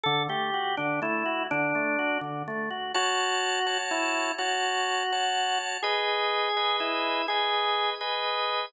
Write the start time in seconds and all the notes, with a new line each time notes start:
0.04 D3 A4
0.29 A3 G4
0.54 F#4
0.77 D3 D4
1.02 A3 E4
1.26 F#4
1.51 D3 D4
1.75 A3
1.99 F#4
2.21 D3
2.48 A3
2.70 F#4
2.94 F#4 C#5 A5
3.66 F#4 C#5 A5
3.91 E4
4.38 F#4 C#5 A5
5.12 F#4 C#5 A5
5.83 G#4 B4 D#5
6.57 G#4 B4 D#5
6.80 E4
7.28 G#4 B4 D#5
8.01 G#4 B4 D#5